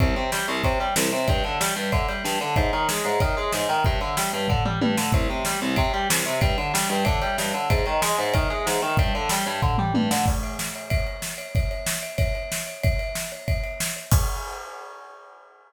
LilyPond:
<<
  \new Staff \with { instrumentName = "Overdriven Guitar" } { \clef bass \time 4/4 \key c \minor \tempo 4 = 187 c,8 c8 g8 c,8 c8 g8 c,8 c8 | g,8 d8 g8 g,8 d8 g8 g,8 d8 | aes,8 ees8 aes8 aes,8 ees8 aes8 aes,8 ees8 | g,8 d8 g8 g,8 d8 g8 g,8 d8 |
c,8 c8 g8 c,8 c8 g8 c,8 c8 | g,8 d8 g8 g,8 d8 g8 g,8 d8 | aes,8 ees8 aes8 aes,8 ees8 aes8 aes,8 ees8 | g,8 d8 g8 g,8 d8 g8 g,8 d8 |
r1 | r1 | r1 | r1 | }
  \new DrumStaff \with { instrumentName = "Drums" } \drummode { \time 4/4 <bd cymr>8 cymr8 sn8 cymr8 <bd cymr>8 cymr8 sn8 cymr8 | <bd cymr>8 cymr8 sn8 cymr8 <bd cymr>8 cymr8 sn8 cymr8 | <bd cymr>8 cymr8 sn8 cymr8 <bd cymr>8 cymr8 sn8 cymr8 | <bd cymr>8 cymr8 sn8 cymr8 <bd tomfh>8 toml8 tommh8 sn8 |
<bd cymr>8 cymr8 sn8 cymr8 <bd cymr>8 cymr8 sn8 cymr8 | <bd cymr>8 cymr8 sn8 cymr8 <bd cymr>8 cymr8 sn8 cymr8 | <bd cymr>8 cymr8 sn8 cymr8 <bd cymr>8 cymr8 sn8 cymr8 | <bd cymr>8 cymr8 sn8 cymr8 <bd tomfh>8 toml8 tommh8 sn8 |
<cymc bd>8 cymr8 sn8 cymr8 <bd cymr>8 cymr8 sn8 cymr8 | <bd cymr>8 cymr8 sn8 cymr8 <bd cymr>8 cymr8 sn8 cymr8 | <bd cymr>8 cymr8 sn8 cymr8 <bd cymr>8 cymr8 sn8 cymr8 | <cymc bd>4 r4 r4 r4 | }
>>